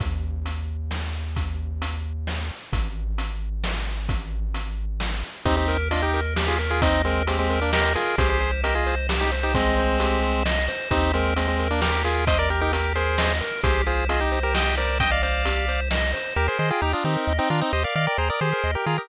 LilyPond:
<<
  \new Staff \with { instrumentName = "Lead 1 (square)" } { \time 3/4 \key ees \major \tempo 4 = 132 r2. | r2. | r2. | r2. |
<c' ees'>16 <c' ees'>8 r16 <d' f'>16 <ees' g'>8 r8 <f' aes'>16 r16 <f' aes'>16 | <c' ees'>8 <aes c'>8 <aes c'>16 <aes c'>8 <bes d'>16 <g' bes'>8 <f' aes'>8 | <aes' c''>16 <aes' c''>8 r16 <g' bes'>16 <f' aes'>8 r8 <ees' g'>16 r16 <ees' g'>16 | <aes c'>2 r4 |
<c' ees'>8 <aes c'>8 <aes c'>16 <aes c'>8 <bes d'>16 <g' bes'>8 <f' aes'>8 | <c'' ees''>16 <bes' d''>16 <g' bes'>16 <ees' g'>16 <g' bes'>8 <aes' c''>4 r8 | <aes' c''>8 <f' aes'>8 <f' aes'>16 <ees' g'>8 <g' bes'>16 <ees'' g''>8 <bes' d''>8 | <ees'' g''>16 <d'' f''>16 <d'' f''>4. r4 |
<g' bes'>16 <aes' c''>16 <aes' c''>16 <f' aes'>16 <ees' g'>16 <d' f'>16 <c' ees'>8. <c' ees'>16 <d' f'>16 <c' ees'>16 | <c'' ees''>16 <d'' f''>16 <d'' f''>16 <bes' d''>16 <aes' c''>16 <bes' d''>16 <aes' c''>8. <g' bes'>16 <f' aes'>16 <g' bes'>16 | }
  \new Staff \with { instrumentName = "Lead 1 (square)" } { \time 3/4 \key ees \major r2. | r2. | r2. | r2. |
g'8 bes'8 ees''8 bes'8 g'8 bes'8 | ees''8 bes'8 g'8 bes'8 ees''8 bes'8 | g'8 c''8 ees''8 c''8 g'8 c''8 | ees''8 c''8 g'8 c''8 ees''8 c''8 |
g'8 bes'8 ees''8 bes'8 g'8 bes'8 | ees''8 bes'8 g'8 bes'8 ees''8 bes'8 | g'8 c''8 ees''8 c''8 g'8 c''8 | ees''8 c''8 g'8 c''8 ees''8 c''8 |
g'16 bes'16 ees''16 g''16 bes''16 ees'''16 g'16 bes'16 ees''16 g''16 bes''16 ees'''16 | g'16 bes'16 ees''16 g''16 bes''16 ees'''16 g'16 bes'16 ees''16 g''16 bes''16 ees'''16 | }
  \new Staff \with { instrumentName = "Synth Bass 1" } { \clef bass \time 3/4 \key ees \major ees,2.~ | ees,2. | aes,,2.~ | aes,,2. |
ees,2.~ | ees,2. | c,2.~ | c,2. |
ees,2.~ | ees,2. | c,2.~ | c,2. |
ees,8 ees8 ees,8 ees8 ees,8 ees8 | ees,8 ees8 ees,8 ees8 ees,8 ees8 | }
  \new DrumStaff \with { instrumentName = "Drums" } \drummode { \time 3/4 <hh bd>4 hh4 sn4 | <hh bd>4 hh4 sn4 | <hh bd>4 hh4 sn4 | <hh bd>4 hh4 sn4 |
<hh bd>8 hh8 hh8 hh8 sn8 hh8 | <hh bd>8 hh8 hh8 hh8 sn8 hh8 | <hh bd>8 hh8 hh8 hh8 sn8 hh8 | <hh bd>8 hh8 hh8 hh8 sn8 hh8 |
<hh bd>8 hh8 hh8 hh8 sn8 hh8 | <hh bd>8 hh8 hh8 hh8 sn8 hh8 | <hh bd>8 hh8 hh8 hh8 sn8 hh8 | <hh bd>8 hh8 hh8 hh8 sn8 hh8 |
r4 r4 r4 | r4 r4 r4 | }
>>